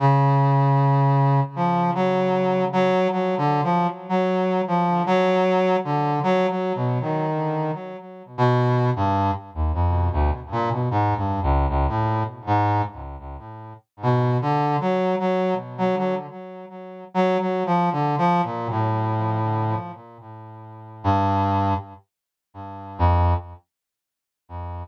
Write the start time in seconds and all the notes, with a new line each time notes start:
0.00 C#3
1.56 F3
1.95 F#3
2.73 F#3
3.12 F#3
3.38 D3
3.64 F3
4.09 F#3
4.68 F3
5.06 F#3
5.84 D3
6.23 F#3
6.49 F#3
6.75 B2
7.01 D#3
8.38 B2
8.96 G2
9.55 D#2
9.74 F2
10.13 D2
10.52 A#2
10.71 B2
10.91 G#2
11.17 G2
11.43 C#2
11.69 C#2
11.88 A2
12.47 G#2
14.03 B2
14.42 D3
14.81 F#3
15.19 F#3
15.78 F#3
15.97 F#3
17.14 F#3
17.40 F#3
17.66 F3
17.92 D3
18.18 F3
18.44 A#2
18.70 A2
21.04 G2
22.99 F2